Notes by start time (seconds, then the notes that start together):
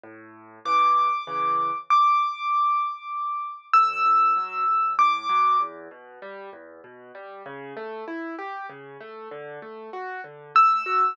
0.03 A2
0.65 C#3 E3 D6
1.27 C#3 E3
1.90 D6
3.73 D2 E6
4.06 A2
4.36 F#3
4.67 D2
4.98 A2 D6
5.29 F#3
5.60 E2
5.91 B2
6.22 G3
6.53 E2
6.84 B2
7.15 G3
7.46 C#3
7.77 A3
8.08 E4
8.39 G4
8.69 C#3
9.00 A3
9.31 D3
9.62 A3
9.93 F#4
10.24 D3
10.55 A3 E6
10.86 F#4